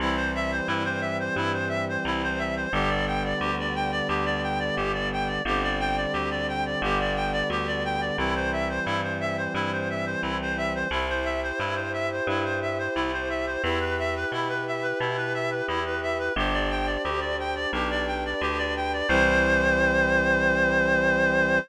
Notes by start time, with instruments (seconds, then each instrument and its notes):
0.00 electric bass (finger) C2, brass section E3 G3 C4, clarinet E4
0.15 clarinet C5
0.35 clarinet E5
0.52 clarinet C5
0.67 electric bass (finger) G2, clarinet E4
0.84 clarinet C5
1.01 clarinet E5
1.20 clarinet C5
1.36 electric bass (finger) G2, clarinet E4
1.53 clarinet C5
1.69 clarinet E5
1.89 clarinet C5
2.05 electric bass (finger) C2, clarinet E4
2.23 clarinet C5
2.39 clarinet E5
2.57 clarinet C5
2.72 electric bass (finger) G1, brass section D3 G3 B3, clarinet G4
2.89 clarinet D5
3.07 clarinet G5
3.24 clarinet D5
3.40 electric bass (finger) D2, clarinet G4
3.59 clarinet D5
3.75 clarinet G5
3.91 clarinet D5
4.08 electric bass (finger) D2, clarinet G4
4.25 clarinet D5
4.43 clarinet G5
4.60 clarinet D5
4.76 electric bass (finger) G1, clarinet G4
4.93 clarinet D5
5.12 clarinet G5
5.27 clarinet D5
5.45 electric bass (finger) G1, brass section D3 G3 C4, clarinet G4
5.62 clarinet D5
5.80 clarinet G5
5.97 clarinet D5
6.13 electric bass (finger) D2, clarinet G4
6.31 clarinet D5
6.48 clarinet G5
6.66 clarinet D5
6.82 electric bass (finger) G1, brass section D3 G3 B3, clarinet G4
6.99 clarinet D5
7.16 clarinet G5
7.32 clarinet D5
7.50 electric bass (finger) D2, clarinet G4
7.67 clarinet D5
7.85 clarinet G5
8.01 clarinet D5
8.18 electric bass (finger) C2, brass section E3 G3 C4, clarinet E4
8.35 clarinet C5
8.52 clarinet E5
8.69 clarinet C5
8.85 electric bass (finger) G2, clarinet E4
9.03 clarinet C5
9.20 clarinet E5
9.37 clarinet C5
9.54 electric bass (finger) G2, clarinet E4
9.72 clarinet C5
9.90 clarinet E5
10.06 clarinet C5
10.22 electric bass (finger) C2, clarinet E4
10.41 clarinet C5
10.57 clarinet E5
10.75 clarinet C5
10.91 electric bass (finger) C2, clarinet E4, brass section E4 G4 C5
11.09 clarinet C5
11.24 clarinet E5
11.43 clarinet C5
11.59 electric bass (finger) G2, clarinet E4
11.75 clarinet C5
11.93 clarinet E5
12.12 clarinet C5
12.27 electric bass (finger) G2, clarinet E4
12.44 clarinet C5
12.62 clarinet E5
12.78 clarinet C5
12.95 electric bass (finger) C2, clarinet E4
13.13 clarinet C5
13.30 clarinet E5
13.47 clarinet C5
13.62 electric bass (finger) E2, brass section E4 G4 B4, clarinet E4
13.80 clarinet B4
13.99 clarinet E5
14.15 clarinet B4
14.32 electric bass (finger) B2, clarinet E4
14.48 clarinet B4
14.67 clarinet E5
14.82 clarinet B4
15.00 electric bass (finger) B2, clarinet E4
15.17 clarinet B4
15.34 clarinet E5
15.51 clarinet B4
15.68 electric bass (finger) E2, clarinet E4
15.85 clarinet B4
16.02 clarinet E5
16.19 clarinet B4
16.36 electric bass (finger) G1, brass section D4 G4 C5, clarinet G4
16.53 clarinet D5
16.71 clarinet G5
16.86 clarinet D5
17.04 electric bass (finger) D2, clarinet G4
17.21 clarinet D5
17.39 clarinet G5
17.56 clarinet D5
17.72 electric bass (finger) B1, brass section D4 G4 B4, clarinet G4
17.90 clarinet D5
18.07 clarinet G5
18.25 clarinet D5
18.41 electric bass (finger) D2, clarinet G4
18.58 clarinet D5
18.77 clarinet G5
18.93 clarinet D5
19.08 electric bass (finger) C2, brass section E3 G3 C4, clarinet C5